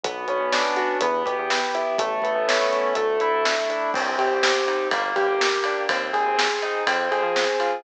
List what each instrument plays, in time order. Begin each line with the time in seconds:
0.03 synth bass 1 B1, pad 2 (warm) B3 C#4 D4 F#4, acoustic grand piano B3, kick, closed hi-hat
0.28 synth bass 1 B1, acoustic grand piano C#4, closed hi-hat
0.40 synth bass 1 B1
0.52 acoustic grand piano D4, snare
0.76 acoustic grand piano F#4, closed hi-hat
1.01 synth bass 1 E2, pad 2 (warm) B3 E4 G4, acoustic grand piano B3, kick, closed hi-hat
1.26 synth bass 1 B2, acoustic grand piano G4, kick, closed hi-hat
1.38 synth bass 1 E2
1.50 acoustic grand piano B3, snare
1.74 acoustic grand piano E4, closed hi-hat
1.98 synth bass 1 A1, pad 2 (warm) A3 B3 C#4 E4, acoustic grand piano A3, kick, closed hi-hat
2.22 synth bass 1 A1, acoustic grand piano B3, kick, closed hi-hat
2.35 synth bass 1 A1
2.48 acoustic grand piano C#4, snare
2.72 acoustic grand piano E4, closed hi-hat
2.95 synth bass 1 D2, acoustic grand piano A3, pad 2 (warm) A3 D4 E4, kick, closed hi-hat
3.20 synth bass 1 D2, acoustic grand piano E4, closed hi-hat
3.33 synth bass 1 D2
3.45 acoustic grand piano A3, snare
3.70 acoustic grand piano D4, closed hi-hat
3.94 synth bass 1 C2, acoustic grand piano C4, kick, crash
4.18 synth bass 1 C3, acoustic grand piano G4, ride
4.30 synth bass 1 C2
4.43 acoustic grand piano C4, snare
4.67 acoustic grand piano D#4, ride
4.91 synth bass 1 G1, acoustic grand piano A#3, kick, ride
5.16 synth bass 1 G2, acoustic grand piano G4, kick, ride
5.28 synth bass 1 G1
5.40 acoustic grand piano A#3, snare
5.64 acoustic grand piano D4, ride
5.89 synth bass 1 D#2, acoustic grand piano C4, kick, ride
6.13 synth bass 1 D#2, acoustic grand piano G#4, kick, ride
6.25 synth bass 1 D#2
6.38 acoustic grand piano C4, snare
6.62 acoustic grand piano D#4, ride
6.87 synth bass 1 F2, acoustic grand piano C4, kick, ride
7.11 synth bass 1 F2, acoustic grand piano G#4, ride
7.23 synth bass 1 F3
7.36 acoustic grand piano C4, snare
7.60 acoustic grand piano F4, ride